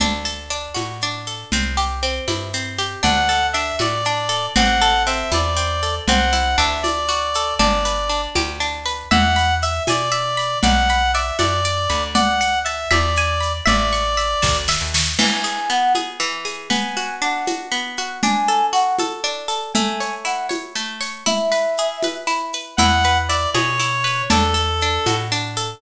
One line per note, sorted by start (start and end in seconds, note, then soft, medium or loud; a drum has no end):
0.00 0.68 D2 medium
0.00 0.50 D4 medium
0.00 low conga medium
0.00 shaker medium
0.25 1.27 A4 medium
0.25 shaker medium
0.50 1.02 D4 medium
0.50 shaker medium
0.74 1.44 A2 medium
0.74 1.47 F#4 medium
0.74 high conga medium
0.74 shaker medium
1.01 1.51 D4 medium
1.01 shaker medium
1.26 1.51 A4 medium
1.26 shaker medium
1.52 2.20 C2 medium
1.52 2.02 C4 medium
1.52 low conga medium
1.52 shaker medium
1.77 2.78 G4 medium
1.77 shaker medium
2.02 2.53 C4 medium
2.02 shaker medium
2.28 2.96 G2 medium
2.28 3.00 E4 medium
2.28 high conga medium
2.28 shaker medium
2.53 3.02 C4 medium
2.53 shaker medium
2.78 3.03 G4 medium
2.78 shaker medium
3.03 3.72 D2 medium
3.03 3.54 D4 medium
3.03 3.47 F#5 medium
3.03 low conga medium
3.03 shaker medium
3.29 4.28 A4 medium
3.29 shaker medium
3.53 4.05 D4 medium
3.53 3.76 E5 medium
3.53 shaker medium
3.79 4.48 A2 medium
3.79 4.51 F#4 medium
3.79 4.46 D5 medium
3.79 high conga medium
3.79 shaker medium
4.05 4.54 D4 medium
4.05 shaker medium
4.29 4.53 A4 medium
4.29 shaker medium
4.55 5.24 A1 medium
4.55 5.06 C4 medium
4.55 5.03 F#5 medium
4.55 low conga loud
4.55 shaker medium
4.81 5.82 A4 medium
4.81 shaker medium
5.06 5.56 C4 medium
5.06 5.31 E5 medium
5.06 shaker medium
5.32 6.00 E2 medium
5.32 6.04 E4 medium
5.32 5.95 D5 medium
5.32 high conga medium
5.32 shaker medium
5.57 6.05 C4 medium
5.57 shaker medium
5.83 6.07 A4 medium
5.83 shaker medium
6.07 6.56 C2 medium
6.07 6.81 C4 medium
6.07 6.56 F#5 medium
6.07 low conga medium
6.07 shaker medium
6.33 6.81 E4 medium
6.33 shaker medium
6.58 7.53 D2 medium
6.58 7.55 D4 loud
6.58 6.82 E5 medium
6.58 shaker medium
6.83 7.54 D5 medium
6.83 high conga medium
6.83 shaker medium
7.09 7.57 F#4 medium
7.09 shaker medium
7.34 7.60 A4 medium
7.34 shaker medium
7.59 8.28 G1 medium
7.59 8.09 D4 medium
7.59 8.21 D5 medium
7.59 low conga medium
7.59 shaker medium
7.85 8.85 B4 medium
7.85 shaker medium
8.09 8.60 D4 medium
8.09 shaker medium
8.35 9.04 D2 medium
8.35 9.08 G4 medium
8.35 high conga medium
8.35 shaker medium
8.60 9.08 D4 medium
8.60 shaker medium
8.86 9.10 B4 medium
8.86 shaker medium
9.11 9.80 E2 medium
9.11 9.62 E5 loud
9.11 9.54 F#5 medium
9.11 low conga loud
9.36 10.37 B5 medium
9.36 shaker medium
9.62 9.83 E5 medium
9.62 10.11 E5 medium
9.62 shaker medium
9.87 10.56 B2 medium
9.87 10.58 D5 medium
9.87 10.60 G#5 medium
9.87 high conga medium
9.87 shaker medium
10.12 10.60 E5 medium
10.12 shaker medium
10.37 10.61 B5 medium
10.37 shaker medium
10.62 11.32 B1 medium
10.62 11.14 D5 medium
10.62 11.11 F#5 medium
10.62 low conga loud
10.62 shaker medium
10.89 11.89 B5 medium
10.89 shaker medium
11.14 11.64 D5 medium
11.14 11.37 E5 medium
11.14 shaker medium
11.39 11.87 F#2 medium
11.39 12.03 D5 medium
11.39 12.11 F#5 medium
11.39 high conga medium
11.39 shaker medium
11.65 12.13 D5 medium
11.65 shaker medium
11.90 12.85 D2 medium
11.90 12.14 B5 medium
11.90 shaker medium
12.14 12.87 D5 medium
12.14 12.59 F#5 medium
12.14 low conga loud
12.14 shaker medium
12.41 12.89 F#5 medium
12.41 shaker medium
12.64 12.89 E5 medium
12.64 12.90 A5 medium
12.64 shaker medium
12.91 13.61 E2 medium
12.91 13.53 D5 medium
12.91 13.63 E5 loud
12.91 high conga medium
12.91 shaker medium
13.16 13.66 G#5 medium
13.16 shaker medium
13.41 13.65 B5 medium
13.41 shaker medium
13.66 14.35 A1 medium
13.66 14.57 D5 medium
13.66 14.17 E5 medium
13.66 low conga medium
13.66 shaker medium
13.93 14.94 C#6 medium
13.93 shaker medium
14.17 14.68 E5 medium
14.17 shaker medium
14.42 14.77 D2 medium
14.42 15.14 A5 medium
14.42 kick medium
14.42 snare medium
14.68 15.17 E5 medium
14.68 snare medium
14.81 15.15 D#2 medium
14.94 15.19 C#6 medium
14.94 snare loud
15.19 16.19 E3 medium
15.19 15.69 G#5 medium
15.19 crash loud
15.19 low conga loud
15.19 shaker medium
15.44 15.95 G#4 medium
15.44 shaker medium
15.68 16.66 B3 medium
15.68 15.93 F#5 medium
15.68 shaker medium
15.95 16.45 G#4 medium
15.95 high conga medium
15.95 shaker medium
16.20 16.68 E3 medium
16.20 shaker medium
16.45 16.69 G#4 medium
16.45 shaker medium
16.70 17.71 B3 medium
16.70 17.15 G#5 medium
16.70 low conga medium
16.70 shaker medium
16.97 17.47 F#4 medium
16.97 shaker medium
17.22 18.18 D4 medium
17.22 17.47 F#5 medium
17.22 shaker medium
17.47 17.98 F#4 medium
17.47 high conga medium
17.47 shaker medium
17.72 18.20 B3 medium
17.72 shaker medium
17.97 18.22 F#4 medium
17.97 shaker medium
18.23 19.23 D4 medium
18.23 18.66 G#5 loud
18.23 low conga loud
18.23 shaker medium
18.48 18.99 A4 medium
18.48 shaker medium
18.72 19.69 F#4 medium
18.72 18.96 F#5 medium
18.72 shaker medium
18.98 19.48 A4 medium
18.98 high conga medium
18.98 shaker medium
19.24 19.72 D4 medium
19.24 shaker medium
19.48 19.72 A4 medium
19.48 shaker medium
19.74 20.75 A3 medium
19.74 20.14 G#5 medium
19.74 low conga loud
19.74 shaker medium
20.00 20.49 C#5 medium
20.00 shaker medium
20.25 21.21 E4 medium
20.25 20.47 F#5 medium
20.25 shaker medium
20.49 21.00 C#5 medium
20.49 high conga medium
20.49 shaker medium
20.75 21.24 A3 medium
20.75 shaker medium
21.01 21.25 C#5 medium
21.01 shaker medium
21.26 22.27 E4 loud
21.26 22.14 E5 medium
21.26 low conga medium
21.26 shaker medium
21.52 22.03 B4 medium
21.52 shaker medium
21.77 22.75 G#4 medium
21.77 shaker medium
22.02 22.53 B4 medium
22.02 high conga medium
22.02 shaker medium
22.27 22.75 E4 medium
22.27 shaker medium
22.53 22.78 B4 medium
22.53 shaker medium
22.77 23.47 E2 medium
22.77 23.29 E4 loud
22.77 23.18 F#5 medium
22.77 low conga loud
22.77 shaker medium
23.03 24.04 B4 medium
23.03 shaker medium
23.29 23.79 E4 medium
23.29 23.50 D5 medium
23.29 shaker medium
23.54 24.23 B2 medium
23.54 24.27 G#4 medium
23.54 24.22 C#5 medium
23.54 high conga medium
23.54 shaker medium
23.80 24.28 E4 medium
23.80 shaker medium
24.04 24.28 B4 medium
24.04 shaker medium
24.30 24.99 E2 medium
24.30 24.82 D4 loud
24.30 25.16 A4 medium
24.30 low conga loud
24.30 shaker medium
24.54 25.56 A4 medium
24.54 shaker medium
24.81 25.31 D4 medium
24.81 shaker medium
25.06 25.75 A2 medium
25.06 25.79 F#4 medium
25.06 high conga medium
25.06 shaker medium
25.32 25.80 D4 medium
25.32 shaker medium
25.56 25.81 A4 medium
25.56 shaker medium